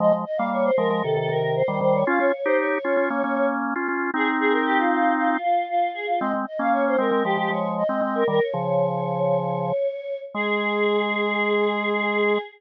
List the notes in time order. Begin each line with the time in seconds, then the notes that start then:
0.00 F3 G#3 D#5
0.13 F3 G#3
0.25 D#5
0.37 G3 A#3 F5
0.52 C#5
0.64 C5
0.77 F3 G#3 A#4
0.90 F3 G#3
1.03 C3 D#3 A4
1.17 C3 D#3 A4
1.29 C3 D#3 A#4
1.56 C5
1.68 D#3 G3
1.81 D#3 G3 C5
1.94 C#5
2.07 C#4 F4 F5
2.20 C#4 F4 C#5
2.34 C#5
2.45 D#4 G4 C5
2.59 C#5
2.84 C#4 F4
2.97 C#4 F4
3.10 A#3 C#4
3.24 A#3 C#4
3.36 A#3 C#4
3.76 C#4 F4
3.88 C#4 F4
4.14 C4 D#4 G#4
4.40 G#4
4.52 A#4
4.66 G4
4.78 F4
4.91 F4
5.18 F4
5.30 F4
5.42 F4
5.69 F4
5.94 G#4
6.07 F4
6.20 G#3 C4 D#5
6.34 G#3 C4
6.47 D#5
6.59 A#3 C#4 F5
6.72 C#5
6.87 C5
6.98 G#3 C4 A#4
7.11 G#3 C4
7.25 F3 G#3 G4
7.37 F3 G#3 G4
7.50 F3 G#3 C#5
7.78 D#5
7.89 G#3 C4
8.02 G#3 C4 D#5
8.15 A#4
8.28 D#3 G3 A#4
8.41 C#5
8.53 C#3 F3
10.34 G#3 G#4